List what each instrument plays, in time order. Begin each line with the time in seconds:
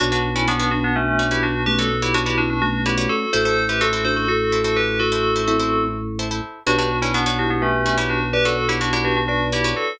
0.00 drawbar organ B1, tubular bells D4 F#4, vibraphone D4 F#4, pizzicato strings F#4 B4 C#5 D5
0.12 tubular bells D4 F#4, pizzicato strings F#4 B4 C#5 D5
0.35 tubular bells C#4 E4, pizzicato strings F#4 B4 C#5 D5
0.48 tubular bells B3 D4, pizzicato strings F#4 B4 C#5 D5
0.60 pizzicato strings F#4 B4 C#5 D5
0.71 vibraphone B3 D4, tubular bells D4 F#4
0.84 tubular bells B3 D4
0.96 tubular bells A3 C#4, vibraphone D4 F#4
1.19 pizzicato strings F#4 B4 C#5 D5
1.31 tubular bells E4 G4, pizzicato strings F#4 B4 C#5 D5
1.43 tubular bells D4 F#4
1.66 vibraphone A3 C#4, tubular bells G4 B4
1.79 pizzicato strings F#4 B4 C#5 D5, tubular bells F#4 A4
2.02 tubular bells E4 G4, pizzicato strings F#4 B4 C#5 D5
2.14 tubular bells D4 F#4, pizzicato strings F#4 B4 C#5 D5
2.26 tubular bells E4 G4, pizzicato strings F#4 B4 C#5 D5
2.38 vibraphone C#4 E4, tubular bells D4 F#4
2.50 tubular bells D4 F#4
2.62 vibraphone A3 C#4, tubular bells D4 F#4
2.86 tubular bells E4 G4, pizzicato strings F#4 B4 C#5 D5
2.98 pizzicato strings F#4 B4 C#5 D5
3.09 tubular bells F#4 A4
3.33 drawbar organ A1, pizzicato strings E4 A4 C5, vibraphone F#4 A4, tubular bells A4 C5
3.45 pizzicato strings E4 A4 C5, tubular bells A4 C5
3.69 pizzicato strings E4 A4 C5, tubular bells G4 B4
3.81 pizzicato strings E4 A4 C5, tubular bells F#4 A4
3.93 pizzicato strings E4 A4 C5
4.05 vibraphone D4 F#4, tubular bells A4 C5
4.16 tubular bells F#4 A4
4.28 tubular bells F#4 A4, vibraphone F#4 A4
4.52 pizzicato strings E4 A4 C5
4.64 pizzicato strings E4 A4 C5, tubular bells F#4 A4
4.76 tubular bells G4 B4
5.00 tubular bells F#4 A4, vibraphone F#4 A4
5.12 pizzicato strings E4 A4 C5
5.36 pizzicato strings E4 A4 C5
5.48 vibraphone C4 E4, pizzicato strings E4 A4 C5
5.60 pizzicato strings E4 A4 C5
6.19 pizzicato strings E4 A4 C5
6.31 pizzicato strings E4 A4 C5
6.66 drawbar organ B1, pizzicato strings D4 F#4 B4 C#5, tubular bells D4 F#4, vibraphone G4 B4
6.78 tubular bells D4 F#4, pizzicato strings D4 F#4 B4 C#5
7.02 tubular bells C#4 E4, pizzicato strings D4 F#4 B4 C#5
7.14 tubular bells B3 D4, pizzicato strings D4 F#4 B4 C#5
7.26 pizzicato strings D4 F#4 B4 C#5
7.39 tubular bells D4 F#4, vibraphone E4 G4
7.50 tubular bells B3 D4
7.62 tubular bells A3 C#4, vibraphone G4 B4
7.86 pizzicato strings D4 F#4 B4 C#5
7.98 pizzicato strings D4 F#4 B4 C#5, tubular bells E4 G4
8.10 tubular bells D4 F#4
8.33 tubular bells G4 B4, vibraphone B4 D5
8.45 pizzicato strings D4 F#4 B4 C#5, tubular bells F#4 A4
8.69 pizzicato strings D4 F#4 B4 C#5, tubular bells E4 G4
8.81 pizzicato strings D4 F#4 B4 C#5, tubular bells D4 F#4
8.93 pizzicato strings D4 F#4 B4 C#5, tubular bells E4 G4
9.04 tubular bells D4 F#4, vibraphone G4 B4
9.17 tubular bells D4 F#4
9.28 tubular bells D4 F#4, vibraphone B4 D5
9.52 pizzicato strings D4 F#4 B4 C#5, tubular bells E4 G4
9.64 pizzicato strings D4 F#4 B4 C#5
9.76 tubular bells F#4 A4